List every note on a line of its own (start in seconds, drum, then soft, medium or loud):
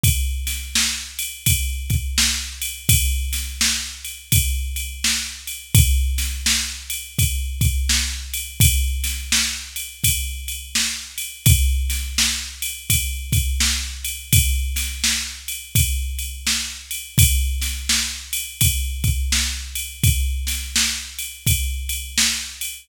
0.03 kick loud
0.03 ride loud
0.47 snare medium
0.47 ride medium
0.75 snare loud
1.19 ride medium
1.46 kick medium
1.46 ride loud
1.90 kick medium
1.90 ride medium
2.18 snare loud
2.62 ride medium
2.89 kick loud
2.89 ride loud
3.33 snare medium
3.33 ride medium
3.61 snare loud
4.04 ride medium
4.32 kick loud
4.32 ride loud
4.76 ride medium
5.04 snare loud
5.47 ride medium
5.75 kick loud
5.75 ride loud
6.18 snare medium
6.18 ride medium
6.46 snare loud
6.90 ride medium
7.19 kick loud
7.19 ride loud
7.61 kick loud
7.61 ride medium
7.89 snare loud
8.34 ride medium
8.60 kick loud
8.60 ride loud
9.04 snare medium
9.04 ride medium
9.32 snare loud
9.76 ride medium
10.04 kick medium
10.04 ride loud
10.48 ride medium
10.75 snare loud
11.18 ride medium
11.46 kick loud
11.46 ride loud
11.90 snare medium
11.90 ride medium
12.18 snare loud
12.62 ride medium
12.90 kick medium
12.90 ride loud
13.32 kick loud
13.32 ride medium
13.60 snare loud
14.04 ride medium
14.33 kick loud
14.33 ride loud
14.76 snare medium
14.76 ride medium
15.04 snare loud
15.48 ride medium
15.75 kick loud
15.75 ride loud
16.19 ride medium
16.47 snare loud
16.91 ride medium
17.18 kick loud
17.18 ride loud
17.61 snare medium
17.61 ride medium
17.89 snare loud
18.33 ride medium
18.61 kick loud
18.61 ride loud
19.04 kick medium
19.04 ride medium
19.32 snare loud
19.75 ride medium
20.04 kick loud
20.04 ride loud
20.47 snare medium
20.47 ride medium
20.76 snare loud
21.19 ride medium
21.47 kick loud
21.47 ride loud
21.89 ride medium
22.18 snare loud
22.61 ride medium